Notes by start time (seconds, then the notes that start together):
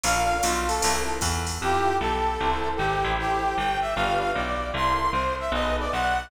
0.04 A#1 D4 F4 A4 A#4 F5, ride
0.43 B1 F4, hi-hat pedal, ride
0.67 A4, ride
0.81 C2 C4 E4 A4 A#4, ride
1.21 E2, kick, hi-hat pedal, ride
1.47 ride
1.61 F2 E4 F4 G4 A4
2.00 B1 A4
2.40 C2 E4 A4 A#4 C5
2.77 G#1 G4
3.04 A1 E4 G4 A4 C5
3.19 G4
3.57 G1 G5
3.81 E5
3.95 G1 D4 F4 G4 B4 F5
4.20 F5
4.35 B1 D5
4.74 C2 E4 A4 A#4 C5 C6
5.12 C2 C5
5.40 E5
5.52 B1 D#4 G#4 A4 B4 D#5
5.79 D5
5.92 B1 F#5